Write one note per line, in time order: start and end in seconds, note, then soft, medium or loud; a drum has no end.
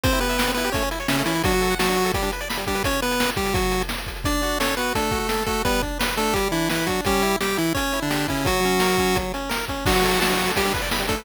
0.04 0.20 C4 loud
0.04 0.12 C4 loud
0.04 0.20 C5 loud
0.04 kick loud
0.04 closed hi-hat loud
0.12 0.20 E4 medium
0.12 closed hi-hat medium
0.20 0.52 B3 medium
0.20 0.28 G4 medium
0.20 0.52 B4 loud
0.20 closed hi-hat medium
0.29 0.37 E5 medium
0.29 closed hi-hat medium
0.38 0.46 G5 medium
0.38 snare loud
0.47 0.55 C4 medium
0.47 closed hi-hat medium
0.54 0.70 B3 medium
0.54 0.65 E4 medium
0.54 0.70 B4 medium
0.54 closed hi-hat medium
0.64 0.72 G4 loud
0.64 closed hi-hat medium
0.72 0.83 A3 loud
0.72 0.89 C#4 medium
0.72 0.89 C#5 medium
0.72 kick loud
0.72 closed hi-hat loud
0.82 0.90 C#4 medium
0.82 closed hi-hat medium
0.91 0.99 E4 medium
0.91 closed hi-hat medium
1.00 1.08 C#5 medium
1.00 closed hi-hat medium
1.08 1.23 C#3 medium
1.08 1.23 C#4 loud
1.08 1.17 E5 medium
1.08 snare loud
1.18 1.26 A3 medium
1.18 closed hi-hat medium
1.26 1.42 E3 medium
1.26 1.34 C#4 medium
1.26 1.42 E4 loud
1.26 closed hi-hat loud
1.35 1.43 E4 medium
1.35 closed hi-hat medium
1.44 1.75 F#3 loud
1.44 1.52 D4 loud
1.44 1.75 F#4 loud
1.44 kick loud
1.44 closed hi-hat loud
1.52 1.62 F#4 medium
1.52 closed hi-hat medium
1.61 1.69 A4 medium
1.61 closed hi-hat medium
1.70 1.78 F#5 medium
1.70 closed hi-hat medium
1.79 2.12 F#3 loud
1.79 2.12 F#4 loud
1.79 1.87 A5 medium
1.79 snare loud
1.88 1.97 D4 medium
1.88 closed hi-hat medium
1.96 2.04 F#4 medium
1.96 closed hi-hat medium
2.05 2.13 A4 medium
2.05 closed hi-hat medium
2.14 2.31 G3 medium
2.14 2.23 G3 medium
2.14 2.31 G4 medium
2.14 kick loud
2.14 closed hi-hat loud
2.22 2.30 D4 medium
2.22 closed hi-hat medium
2.32 2.41 B4 medium
2.32 closed hi-hat medium
2.40 2.48 D5 medium
2.40 closed hi-hat medium
2.49 2.57 B5 medium
2.49 snare loud
2.57 2.65 G3 medium
2.57 closed hi-hat medium
2.67 2.83 G3 medium
2.67 2.75 D4 medium
2.67 2.83 G4 medium
2.67 kick medium
2.67 closed hi-hat medium
2.75 2.83 B4 medium
2.75 closed hi-hat medium
2.84 3.01 C#4 medium
2.84 3.01 C#5 loud
2.84 kick loud
2.84 closed hi-hat loud
2.93 closed hi-hat medium
3.02 3.30 B3 loud
3.02 3.30 B4 loud
3.02 closed hi-hat medium
3.11 closed hi-hat medium
3.20 snare loud
3.29 closed hi-hat medium
3.36 3.54 G3 medium
3.36 3.54 G4 loud
3.36 kick loud
3.36 closed hi-hat medium
3.46 closed hi-hat medium
3.54 3.83 F#3 medium
3.54 3.83 F#4 loud
3.54 kick loud
3.54 closed hi-hat loud
3.62 closed hi-hat medium
3.71 closed hi-hat medium
3.81 closed hi-hat medium
3.89 snare loud
3.98 closed hi-hat medium
4.06 kick medium
4.06 closed hi-hat medium
4.16 closed hi-hat medium
4.24 4.58 D4 medium
4.24 4.41 D4 loud
4.24 4.58 D5 loud
4.24 kick loud
4.24 closed hi-hat loud
4.42 4.59 F#4 medium
4.42 closed hi-hat medium
4.60 4.75 C#4 medium
4.60 4.76 A4 medium
4.60 4.75 C#5 medium
4.60 snare loud
4.77 4.93 B3 medium
4.77 4.94 F#4 medium
4.77 4.93 B4 medium
4.77 closed hi-hat medium
4.95 5.19 A3 medium
4.95 5.11 D4 medium
4.95 5.19 A4 medium
4.95 kick medium
4.95 closed hi-hat loud
5.11 5.27 F#4 medium
5.11 kick loud
5.11 closed hi-hat medium
5.19 5.44 A3 medium
5.19 5.44 A4 medium
5.29 5.46 A4 medium
5.29 snare loud
5.46 5.62 A3 medium
5.46 5.63 F#4 medium
5.46 5.62 A4 loud
5.46 kick medium
5.46 closed hi-hat medium
5.65 5.81 G3 loud
5.65 5.82 B3 loud
5.65 5.82 B4 loud
5.65 kick loud
5.65 closed hi-hat medium
5.81 5.98 D4 medium
5.81 kick medium
5.81 closed hi-hat medium
5.99 6.15 B4 medium
5.99 snare loud
6.16 6.34 A3 loud
6.16 6.34 D4 medium
6.16 6.34 A4 loud
6.16 closed hi-hat medium
6.33 6.48 G3 medium
6.33 6.51 G3 loud
6.33 6.48 G4 loud
6.33 kick medium
6.33 closed hi-hat loud
6.52 6.69 E3 medium
6.52 6.68 D4 medium
6.52 6.69 E4 loud
6.52 closed hi-hat medium
6.69 6.88 E3 medium
6.69 6.88 E4 medium
6.69 6.86 B4 medium
6.69 snare loud
6.87 7.01 F#3 medium
6.87 7.05 D4 medium
6.87 7.01 F#4 loud
6.87 kick medium
6.87 closed hi-hat medium
7.05 7.36 G3 loud
7.05 7.23 C#4 loud
7.05 7.36 G4 loud
7.05 kick loud
7.05 closed hi-hat loud
7.22 7.38 E4 medium
7.22 closed hi-hat medium
7.40 7.58 G3 medium
7.40 7.58 G4 medium
7.40 7.57 G4 loud
7.40 snare loud
7.57 7.73 E3 loud
7.57 7.73 E4 medium
7.57 7.73 E4 loud
7.57 closed hi-hat medium
7.74 8.00 C#4 medium
7.74 7.92 C#4 medium
7.74 8.00 C#5 loud
7.74 kick loud
7.74 closed hi-hat loud
7.92 8.09 E4 medium
7.92 closed hi-hat medium
8.02 8.27 D3 medium
8.02 8.27 D4 medium
8.10 8.26 G4 medium
8.10 snare loud
8.28 8.46 C#3 medium
8.28 8.46 C#4 medium
8.28 8.44 E4 medium
8.28 kick medium
8.28 open hi-hat medium
8.45 8.60 F#3 loud
8.45 9.18 F#3 loud
8.45 9.18 F#4 loud
8.45 kick loud
8.45 closed hi-hat loud
8.63 8.81 C#4 medium
8.63 closed hi-hat medium
8.80 8.96 A#4 medium
8.80 snare loud
8.98 9.15 C#4 medium
8.98 kick medium
8.98 closed hi-hat medium
9.15 9.32 F#3 loud
9.15 kick loud
9.15 closed hi-hat loud
9.34 9.50 C#4 medium
9.34 closed hi-hat medium
9.49 9.65 A#4 loud
9.49 snare loud
9.68 9.85 C#4 medium
9.68 kick medium
9.68 closed hi-hat medium
9.86 10.20 F#3 loud
9.86 9.93 D4 loud
9.86 10.20 F#4 loud
9.86 kick loud
9.86 crash loud
9.95 10.03 F#4 medium
9.95 closed hi-hat medium
10.03 10.12 A4 medium
10.03 closed hi-hat medium
10.12 10.22 F#5 medium
10.12 closed hi-hat medium
10.20 10.52 F#3 medium
10.20 10.52 F#4 loud
10.20 10.28 A5 loud
10.20 snare loud
10.30 10.37 D4 medium
10.30 closed hi-hat medium
10.38 10.46 F#4 loud
10.38 closed hi-hat medium
10.47 10.55 A4 medium
10.47 closed hi-hat medium
10.56 10.64 G3 loud
10.56 10.73 G3 medium
10.56 10.73 G4 loud
10.56 kick medium
10.56 closed hi-hat loud
10.65 10.73 D4 medium
10.65 closed hi-hat medium
10.74 10.82 B4 medium
10.74 kick loud
10.74 closed hi-hat medium
10.82 10.89 D5 medium
10.82 closed hi-hat medium
10.91 11.00 B5 medium
10.91 snare loud
10.99 11.07 G3 medium
10.99 closed hi-hat medium
11.08 11.24 A3 medium
11.08 11.16 D4 medium
11.08 11.24 A4 loud
11.08 kick loud
11.08 closed hi-hat medium
11.17 11.25 B4 medium
11.17 open hi-hat medium